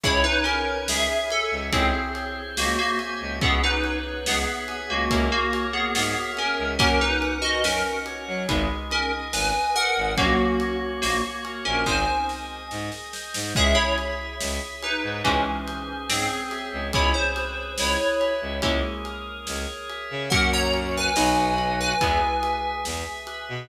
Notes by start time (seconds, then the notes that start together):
0.04 C#2 C#4 E4 G#4 C#5, kick, crash
0.24 D#4 B4
0.44 C#4 A#4 G#5, ride
0.88 C#2 G#4 C#5 E5, snare
1.30 A4 E5, ride
1.51 C#2
1.72 C#2 C4 C#4 E4 G#4 C5, kick, ride
2.15 C#5, ride
2.57 C#2 A#3 F#4 E5, snare
2.78 A#3 F#4
2.99 G#5, ride
3.21 C#2
3.41 C#2 B3 C#4 E4 G#4 B4, kick, ride
3.63 D#4 B4
3.84 C#5, ride
4.26 C#2 B3 G#4 E5, snare
4.68 G#5, ride
4.89 C#2 A#3 F#4
5.10 C#2 A#3 C#4 E4 G#4 A#4, kick, ride
5.32 A#3 F#4
5.53 C#5, ride
5.73 B3 G#4
5.95 G#2 B3 G#4 E5, snare
6.37 C#4 A#4 G#5, ride
6.59 C#2
6.79 F#2 A#3 C#4 F#4 A#4, kick, ride
7.01 D#4 B4
7.22 F#5, ride
7.42 F#4 D#5
7.64 F#2 C#4 A#4, snare
8.06 C#5, ride
8.28 F#3
8.48 G#1 G#3 B3 D#4 G#4, kick, ride
8.90 C#4 A#4 D#5, ride
9.33 G#1 G#4 B4 G#5, snare
9.75 A#4 B4 F#5, ride
9.97 G#1
10.17 A#1 F#3 A#3 C#4 F#4, kick, ride
10.60 C#5, ride
11.02 A#1 A#3 F#4, snare
11.44 A#4, ride
11.65 A#1 C#4 A#4
11.86 G#1 G#3 C4 D#4 G#4 C5 G#5, kick, snare
12.29 D#5, snare
12.71 G#2 G#4, snare
12.92 snare
13.13 C5, snare
13.34 G#2, snare
13.55 C#2 G#3 C#4 E4 G#4 E5, kick, crash
13.75 E4 C#5
13.98 E5, ride
14.40 C#2 G#4, snare
14.82 D#4 B4 C#5, ride
15.03 G#2
15.24 C#2 E3 G#3 C4 C#4 E4 G#4, kick, ride
15.67 C5, ride
16.09 G#2 C4 G#4 C#5, snare
16.51 E5, snare, ride
16.73 C#2
16.93 C#2 G#3 B3 C#4 E4 G#4 C#5, kick, ride
17.14 C5
17.36 B4, ride
17.78 C#2 E4 C#5, snare
18.20 E5, ride
18.42 C#2
18.62 C#2 G#3 A#3 C#4 E4 G#4, kick, ride
19.05 A#4, ride
19.47 C#2 C#5, snare
19.89 E5, ride
20.11 C#3
20.30 F#2 F#3 A#3 C#4 F#4 A#4 F#5, kick, ride
20.53 C#5 A#5
20.73 A#4, ride
20.97 B4 G#5
21.16 B1 F#3 B3 D#4 F#4 B4 D#5, snare
21.58 ride
21.80 B4 G#5
22.01 E2 G#3 B3 E4 G#4, kick, ride
22.42 E5, ride
22.85 E2 G#4, snare
23.27 B4, ride
23.49 B2